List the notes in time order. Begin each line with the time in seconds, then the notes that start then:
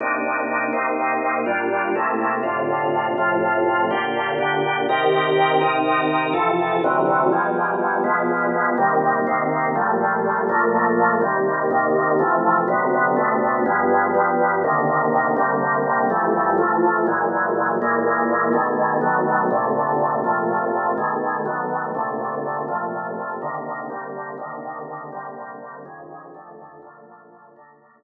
0.00 C3 A#3 D4 D#4
0.73 C3 A#3 C4 D#4
1.46 A#2 G3 D4 F4
1.95 C3 A3 A#3 E4
2.43 A2 C3 D3 F4
3.18 A2 C3 F3 F4
3.91 A#2 D3 F4 G4
4.39 A#2 D3 D4 G4
4.89 C3 D#3 G4 A#4
5.61 C3 D#3 D#4 A#4
6.33 F2 C3 E3 A4
6.84 D2 C3 E3 F#3
7.32 B2 F3 G3 G#3
8.04 B2 F3 G#3 B3
8.78 C3 D#3 G3 A#3
9.27 C3 D#3 A#3 C4
9.75 A#2 F3 G3 A3
10.49 A#2 F3 A3 A#3
11.21 D#2 C3 G3 A#3
11.71 D#2 C3 D#3 A#3
12.19 C3 E3 F3 A3
12.68 D2 C3 F#3 B3
13.16 D2 C3 A3 B3
13.66 G2 F3 G#3 B3
14.15 G2 F3 G3 B3
14.64 C3 D3 D#3 A#3
15.36 C3 D3 G3 A#3
16.10 F2 E3 G3 A3
16.58 F2 E3 F3 A3
17.07 A#2 E3 F#3 G#3
17.82 A#2 E3 G#3 A#3
18.53 B2 D#3 G#3 A3
19.01 B2 D#3 F#3 A3
19.51 A#2 C3 D3 A3
20.24 A#2 C3 F3 A3
20.98 B2 D#3 G#3 A3
21.45 B2 D#3 F#3 A3
21.95 A#2 C3 D3 A3
22.68 A#2 C3 F3 A3
23.42 C3 D3 D#3 A#3
23.90 C3 D3 G3 A#3
24.38 C3 D3 D#3 A#3
25.12 C3 D3 G3 A#3
25.85 F2 C#3 D#3 G#3
26.34 F2 D3 D#3 A3
26.82 A#2 D3 F3 A3
27.56 A#2 D3 A3 A#3